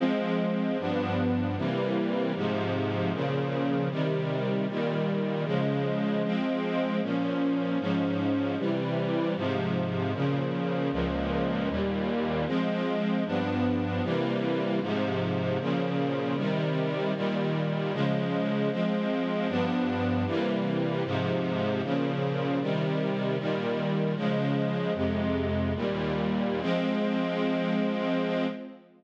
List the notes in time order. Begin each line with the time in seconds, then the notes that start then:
0.00 F3 G#3 C4
0.78 G2 F3 B3 D4
1.56 C3 E3 G3 A#3
2.35 G#2 C3 F3
3.12 A#2 C#3 F3
3.90 C3 D#3 G3
4.67 A#2 D#3 G3
5.45 C#3 F3 G#3
6.23 F3 G#3 C4
7.01 A#2 F3 C#4
7.79 G#2 F3 C#4
8.58 C3 E3 G3
9.35 G#2 C3 F3
10.13 A#2 C#3 F3
10.92 C#2 A#2 F3
11.68 D#2 A#2 G3
12.46 F3 G#3 C4
13.25 G2 F3 B3 D4
14.03 C3 E3 G3 A#3
14.80 G#2 C3 F3
15.59 A#2 C#3 F3
16.36 C3 D#3 G3
17.15 A#2 D#3 G3
17.92 C#3 F3 G#3
18.70 F3 G#3 C4
19.48 G2 F3 B3 D4
20.26 C3 E3 G3 A#3
21.04 G#2 C3 F3
21.82 A#2 C#3 F3
22.60 C3 D#3 G3
23.37 A#2 D#3 G3
24.15 C#3 F3 G#3
24.93 F2 C3 G#3
25.75 D#2 A#2 G3
26.61 F3 G#3 C4